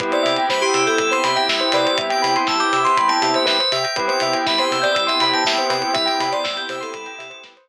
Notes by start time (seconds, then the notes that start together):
0.00 C2 B3 C4 E4 G4 B4, kick, closed hi-hat
0.12 C5 D5, closed hi-hat
0.23 C3 E5, open hi-hat
0.36 G5, closed hi-hat
0.49 C2 C5 B5, kick, snare
0.62 G4 C6, closed hi-hat
0.74 C3 E6, open hi-hat
0.87 A4 G6, closed hi-hat
0.98 C2 E6, kick, closed hi-hat
1.11 C5 C6, closed hi-hat
1.24 C3 B5, open hi-hat
1.36 E5 G5, closed hi-hat
1.48 C2 E5, kick, snare
1.60 C5, closed hi-hat
1.72 C3 B4 D5, open hi-hat
1.85 C5, closed hi-hat
1.98 C2 E5, kick, closed hi-hat
2.10 G5, closed hi-hat
2.22 C3 B5, open hi-hat
2.36 C6, closed hi-hat
2.47 C2 A5 E6, kick, snare
2.60 D6 G6, closed hi-hat
2.73 C3 E6, open hi-hat
2.85 C6, closed hi-hat
2.97 C2 B5, kick, closed hi-hat
3.08 G5 A5, closed hi-hat
3.22 C3 E5, open hi-hat
3.34 C5 E5, closed hi-hat
3.46 C2 B4 E5, kick, snare
3.60 C5, closed hi-hat
3.72 C3 E5 G5, open hi-hat
3.84 G5, closed hi-hat
3.96 C2 B3 C4 E4 G4 B4, kick, closed hi-hat
4.08 C5 G5, closed hi-hat
4.20 C3 E5, open hi-hat
4.33 G5, closed hi-hat
4.46 C2 E5 B5, kick, snare
4.58 C5 C6, closed hi-hat
4.71 C3 E6, open hi-hat
4.82 D5 G6, closed hi-hat
4.95 C2 E6, kick, closed hi-hat
5.07 E5 C6, closed hi-hat
5.20 C3 B5, open hi-hat
5.33 G5 A5, closed hi-hat
5.45 C2 E5 G5, kick, snare
5.57 C5, closed hi-hat
5.70 C3 B4 G5, open hi-hat
5.82 C5, closed hi-hat
5.94 C2 E5, kick, closed hi-hat
6.06 G5, closed hi-hat
6.20 C3 B5, open hi-hat
6.32 D5 C6, closed hi-hat
6.44 C2 E6, kick, snare
6.57 G6, closed hi-hat
6.69 C3 C5 E6, open hi-hat
6.81 A4 C6, closed hi-hat
6.94 C2 B5, kick, closed hi-hat
7.06 G5, closed hi-hat
7.18 C3 E5, open hi-hat
7.30 C5, closed hi-hat
7.43 C2 B4, kick, snare
7.57 C5, closed hi-hat